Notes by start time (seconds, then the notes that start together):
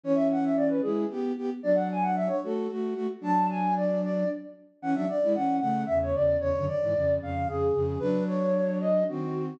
0.04 E3 C#4 C#5
0.15 E5
0.32 F#5
0.44 E5
0.57 D5
0.68 B4
0.82 G#3 E4 G#4
1.10 B3 G4
1.37 B3 G4
1.63 F#3 D4 D5
1.75 F#5
1.91 G#5
2.03 F#5
2.16 E5
2.28 C#5
2.43 A3 F#4 A4
2.70 A3 F#4
2.94 A3 F#4
3.21 F#3 D4 A5
3.50 G#5
3.76 D5
4.03 D5
4.82 E3 C#4 F#5
4.93 F#3 D4 E5
5.08 D5
5.23 G#3 E4
5.35 E3 C#4 F#5
5.60 C#3 A3 F#5
5.86 E2 C#3 E5
6.02 C#5
6.14 E2 C#3 D5
6.39 E2 C#3 C#5
6.56 F#2 D3
6.67 D5
6.82 G#2 E3
6.95 F2 C#3
7.21 F2 C#3 F5
7.47 F2 C#3 G#4
7.74 F2 C#3
7.99 F#3 D4 B4
8.27 C#5
8.80 D#5
9.08 D#3 C4 F#4